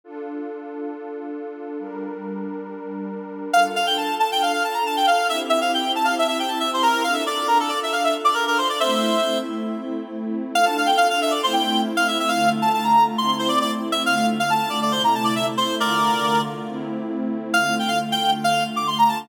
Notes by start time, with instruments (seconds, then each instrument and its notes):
0.04 pad 2 (warm) D4 F4 A4
1.79 pad 2 (warm) G3 D4 A#4
3.53 pad 2 (warm) D4 F4 A4, clarinet F5
3.76 clarinet F5
3.86 clarinet G5
3.97 clarinet A5
4.19 clarinet A5
4.32 clarinet G5
4.42 clarinet F5
4.52 clarinet F5
4.64 clarinet A5
4.74 clarinet A#5
4.86 clarinet A5
4.97 clarinet G5
5.06 clarinet F5
5.29 pad 2 (warm) C4 E4 G4, clarinet E5
5.49 clarinet E5
5.61 clarinet F5
5.74 clarinet G5
5.95 clarinet A5
6.04 clarinet F5
6.18 clarinet E5
6.27 clarinet E5
6.39 clarinet G5
6.48 clarinet A5
6.60 clarinet E5
6.73 clarinet C5
6.82 clarinet A#4
7.03 pad 2 (warm) D4 F4 A4, clarinet F5
7.13 clarinet E5
7.26 clarinet D5
7.47 clarinet A#4
7.59 clarinet A4
7.69 clarinet D5
7.83 clarinet E5
7.92 clarinet F5
8.04 clarinet E5
8.24 clarinet D5
8.34 clarinet A#4
8.47 clarinet A#4
8.58 clarinet C5
8.69 clarinet D5
8.79 pad 2 (warm) A3 C4 E4, clarinet C5 E5
10.54 pad 2 (warm) D4 F4 A4, clarinet F5
10.65 clarinet A5
10.77 clarinet F5
10.86 clarinet G5
10.97 clarinet F5
11.10 clarinet F5
11.22 clarinet E5
11.31 clarinet D5
11.43 pad 2 (warm) A3 C4 E4, clarinet C5
11.53 clarinet G5
11.97 clarinet F5
12.08 clarinet E5
12.19 clarinet E5
12.28 pad 2 (warm) D3 A3 F4, clarinet F5
12.62 clarinet A5
12.74 clarinet A5
12.83 clarinet A#5
13.18 pad 2 (warm) A3 C4 E4, clarinet C6
13.39 clarinet C5
13.48 clarinet D5
13.61 clarinet D5
13.92 clarinet E5
14.06 pad 2 (warm) D3 A3 F4, clarinet F5
14.16 clarinet F5
14.40 clarinet F5
14.50 clarinet A5
14.70 clarinet D5
14.82 clarinet D5
14.92 pad 2 (warm) C3 A3 E4, clarinet C5
15.04 clarinet A#5
15.15 clarinet A5
15.24 clarinet D5
15.35 clarinet E5
15.57 clarinet C5
15.80 pad 2 (warm) D3 A3 F4, clarinet A#4 D5
16.68 pad 2 (warm) A3 C4 E4
17.54 pad 2 (warm) D3 A3 F4, clarinet F5
17.79 clarinet G5
17.88 clarinet F5
18.12 clarinet G5
18.44 clarinet F5
18.76 clarinet D6
18.87 clarinet C6
18.98 clarinet A#5
19.08 clarinet A5